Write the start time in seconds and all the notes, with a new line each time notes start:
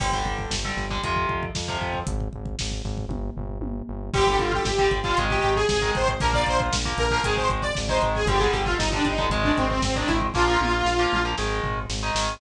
0.00 G1 D3 G3, kick, crash
0.13 D3 G3, kick
0.24 G1, kick
0.39 kick
0.50 G1, kick, snare
0.64 D3 G3, kick
0.77 G1, kick, snare
0.90 D3 G3, kick
1.03 F2 C3 F3, kick, closed hi-hat
1.16 kick
1.29 F2, kick
1.43 kick
1.55 F2, kick, snare
1.68 C3 F3, kick
1.81 F2, kick
1.94 kick
2.07 G#1, kick, closed hi-hat
2.20 kick
2.33 G#1, kick
2.45 kick
2.59 G#1, kick, snare
2.72 kick
2.84 G#1, kick, snare
2.98 kick
3.08 G1, kick, high tom
3.37 G1, floor tom
3.60 G1, high tom
3.89 G1
4.14 G1 D3 G3 G4, kick, crash
4.27 D3 G3, kick
4.39 G1 F4, kick, closed hi-hat
4.52 G4, kick
4.65 G1, kick, snare
4.78 D3 G3, kick
4.91 G1, kick, closed hi-hat
5.03 D3 G3 F4, kick
5.17 G#1 D#3 G#3, kick, closed hi-hat
5.30 G4, kick
5.42 G#1, kick, closed hi-hat
5.56 G#4, kick
5.69 G#1, kick, snare
5.82 D#3 G#3, kick
5.95 G#1 C5, kick, closed hi-hat
6.08 kick
6.20 A#1 F3 A#3 A#4, kick, closed hi-hat
6.33 F3 A#3 D5, kick
6.46 A#1 C5, kick, closed hi-hat
6.60 kick
6.72 A#1, kick, snare
6.85 F3 A#3, kick
6.98 A#1 A#4, kick, closed hi-hat
7.11 F3 A#3, kick
7.24 G#1 D#3 G#3 G#4, kick, closed hi-hat
7.37 C5, kick
7.49 G#1, kick, closed hi-hat
7.62 D5, kick
7.75 G#1, kick, snare
7.89 D#3 G#3 C5, kick
8.02 G#1, kick, closed hi-hat
8.15 G#4, kick
8.26 G1 D3 G3 G4, kick, closed hi-hat
8.39 D3 G3 G#4, kick
8.52 G1 G4, kick, closed hi-hat
8.65 F4, kick
8.77 G1 D#4, kick, snare
8.92 D3 G3 D4, kick
9.05 G1 D#4, kick, closed hi-hat
9.18 D3 G3, kick
9.30 G#1 D#3 G#3, kick, closed hi-hat
9.44 D4, kick
9.57 G#1 C4, kick, closed hi-hat
9.69 C4, kick
9.82 G#1 C4, kick, snare
9.96 D#3 G#3 D4, kick
10.07 G#1 E4, kick, closed hi-hat
10.21 kick
10.34 A#1 F3 A#3 F4, kick, snare
10.47 F3 A#3
10.61 A#1, high tom
10.85 A#1, snare
10.99 F3 A#3
11.12 A#1, mid tom
11.25 F3 A#3
11.38 G#1 D#3 G#3, snare
11.63 G#1, floor tom
11.89 G#1, snare
12.03 D#3 G#3
12.15 G#1, snare